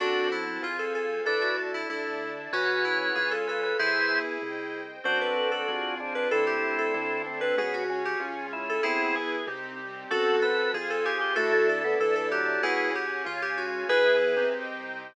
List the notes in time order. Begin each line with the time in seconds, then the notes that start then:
0.00 F#2 C4 D4 F#4 A4 C5 F#5 A5
0.32 E4
0.62 F2 C4 F4 G#4 C5 F5 G#5
0.79 A4
0.95 A4
1.25 D2 D4 E4 A4 B4 D5 E5 A5
1.42 F#4
1.74 E4
1.90 D2 D4 E4 A4 D5 E5 A5
2.52 C#2 C#4 F#4 G#4 B4 C#5 F#5 G#5
2.85 E4
3.15 C#2 C#4 F4 G#4 C#5 F5 G#5
3.31 A4
3.47 A4 B4
3.63 B4
3.79 E2 E4 G#4 B4 C5 E5 G#5
4.42 C2 C5 D#5 G5
5.04 F#2 C4 D4 F#4 A4 C5
5.21 B4
5.37 C4 A4 C5
5.51 A4
5.68 F2 C4 F4 G#4
6.00 C4 D4 G#4 C5
6.15 D4 B4
6.31 D2 C4 D4 E4 A4
6.47 G4
6.63 A3 D4 A4
6.78 A4
6.94 D2 D4 E4 A4
7.26 A3 C4 D4 A4
7.41 C4 B4
7.57 C#2 B3 C#4 F#4 G#4
7.74 F#4
7.89 C#4 G#4 C#5
8.05 G4
8.20 C#2 C#4 F4 G#4
8.53 C#4 E4 G#4 C#5
8.69 A4
8.83 E2 B3 C4 E4 G#4
9.15 B3 G#4 B4
9.47 C2 C4 D#4 G4
9.79 G3 C4 G4
10.10 F#2 C4 F#4 A4 C5 F#5 A5
10.42 A4 B4
10.73 F2 C4 F4 G#4 C5 F5 G#5
10.90 A4
11.05 G4 G#4
11.21 G4
11.36 D2 A3 D4 E4 F#4 A4 D5 E5 A5
11.53 A3
11.69 A4
11.84 B3 D4 E4 A4
11.99 D2 E3 A4 D5 E5 A5
12.16 E3 A4
12.31 F#3 G4
12.63 C#2 B3 C#4 E4 F#4 G#4 C#5 F#5 G#5
12.95 G4
13.25 C#2 C#4 F4 G#4 C#5 F5 G#5
13.42 G4
13.58 F#4
13.88 E2 B3 E4 G#4 B4 E5 G#5
14.37 C4 D#4 G4
14.53 C2 C5 D#5 G5